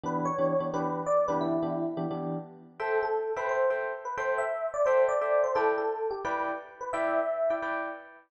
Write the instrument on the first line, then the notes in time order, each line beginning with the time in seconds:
electric piano 1
0.04 E3 B3 D4 G4 B4
0.25 C#5
0.38 E3 B3 D4 G4
0.60 E3 B3 D4 G4
0.74 E3 B3 D4 G4 B4
1.06 D5
1.28 E3 B3 D4 G4 B4
1.41 E4
1.63 E3 B3 D4 G4
1.97 E3 B3 D4 G4
2.11 E3 B3 D4 G4
2.80 A4 C5 E5 G5
3.03 A4
3.36 A4 B4 C5 E5 G5
3.49 C5
3.70 A4 C5 E5 G5
4.05 B4
4.17 A4 C5 E5 G5
4.38 E5
4.74 D5
4.86 A4 C5 E5 G5
5.09 D5
5.21 A4 C5 E5 G5
5.44 C5
5.55 E4 A4 B4 D5 G5
5.78 A4
6.11 G4
6.25 E4 B4 D5 G5
6.81 B4
6.93 E4 B4 D5 E5 G5
7.50 E4 B4 D5 G5
7.62 E4 B4 D5 G5